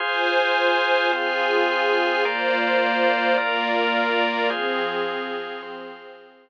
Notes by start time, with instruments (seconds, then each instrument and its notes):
0.00 drawbar organ F4 G#4 C5, pad 2 (warm) F4 C5 G#5
1.12 drawbar organ C4 F4 C5, pad 2 (warm) F4 G#4 G#5
2.25 drawbar organ A#3 F4 C5 D5, pad 2 (warm) A#3 F4 C5 D5
3.38 drawbar organ A#3 F4 A#4 D5, pad 2 (warm) A#3 F4 A#4 D5
4.50 pad 2 (warm) F3 C4 G#4, drawbar organ F4 G#4 C5
5.62 drawbar organ C4 F4 C5